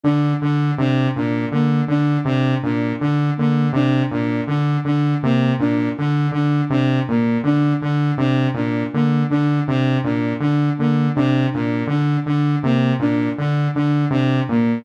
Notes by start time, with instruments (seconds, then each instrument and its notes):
0.04 lead 2 (sawtooth) D3, flute D4
0.41 lead 2 (sawtooth) D3, flute D4
0.78 lead 2 (sawtooth) C3, flute D4
1.15 lead 2 (sawtooth) A#2, flute D4
1.52 lead 2 (sawtooth) D3, flute A#3
1.88 lead 2 (sawtooth) D3, flute D4
2.25 lead 2 (sawtooth) C3, flute D4
2.63 lead 2 (sawtooth) A#2, flute D4
3.00 lead 2 (sawtooth) D3, flute D4
3.37 lead 2 (sawtooth) D3, flute A#3
3.73 lead 2 (sawtooth) C3, flute D4
4.11 lead 2 (sawtooth) A#2, flute D4
4.47 lead 2 (sawtooth) D3, flute D4
4.85 lead 2 (sawtooth) D3, flute D4
5.22 lead 2 (sawtooth) C3, flute A#3
5.59 lead 2 (sawtooth) A#2, flute D4
5.97 lead 2 (sawtooth) D3, flute D4
6.32 lead 2 (sawtooth) D3, flute D4
6.70 lead 2 (sawtooth) C3, flute D4
7.08 lead 2 (sawtooth) A#2, flute A#3
7.44 lead 2 (sawtooth) D3, flute D4
7.82 lead 2 (sawtooth) D3, flute D4
8.18 lead 2 (sawtooth) C3, flute D4
8.54 lead 2 (sawtooth) A#2, flute D4
8.93 lead 2 (sawtooth) D3, flute A#3
9.30 lead 2 (sawtooth) D3, flute D4
9.67 lead 2 (sawtooth) C3, flute D4
10.04 lead 2 (sawtooth) A#2, flute D4
10.40 lead 2 (sawtooth) D3, flute D4
10.78 lead 2 (sawtooth) D3, flute A#3
11.15 lead 2 (sawtooth) C3, flute D4
11.52 lead 2 (sawtooth) A#2, flute D4
11.87 lead 2 (sawtooth) D3, flute D4
12.26 lead 2 (sawtooth) D3, flute D4
12.63 lead 2 (sawtooth) C3, flute A#3
12.99 lead 2 (sawtooth) A#2, flute D4
13.38 lead 2 (sawtooth) D3, flute D4
13.74 lead 2 (sawtooth) D3, flute D4
14.10 lead 2 (sawtooth) C3, flute D4
14.49 lead 2 (sawtooth) A#2, flute A#3